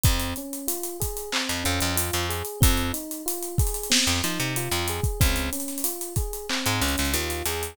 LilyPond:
<<
  \new Staff \with { instrumentName = "Electric Piano 1" } { \time 4/4 \key f \minor \tempo 4 = 93 c'8 des'8 f'8 aes'8 c'8 des'8 f'8 aes'8 | c'8 ees'8 f'8 aes'8 c'8 ees'8 f'8 aes'8 | c'8 des'8 f'8 aes'8 c'8 des'8 f'8 aes'8 | }
  \new Staff \with { instrumentName = "Electric Bass (finger)" } { \clef bass \time 4/4 \key f \minor f,2~ f,16 f,16 f,16 f,8 f,8. | f,2~ f,16 f,16 f16 c8 f,8. | des,2~ des,16 aes,16 des,16 des,16 ees,8 e,8 | }
  \new DrumStaff \with { instrumentName = "Drums" } \drummode { \time 4/4 <hh bd>16 hh16 hh16 hh16 hh16 hh16 <hh bd>16 hh16 hc16 hh16 hh16 hh16 hh16 hh16 hh16 hh16 | <hh bd>16 hh16 hh16 hh16 hh16 hh16 <hh bd>32 hh32 hh32 hh32 sn16 hh16 hh16 hh16 hh16 hh16 hh16 <hh bd>16 | <hh bd>16 hh16 hh32 hh32 <hh sn>32 hh32 hh16 hh16 <hh bd>16 hh16 hc16 hh16 hh32 hh32 <hh sn>32 hh32 hh16 hh16 hh16 hh16 | }
>>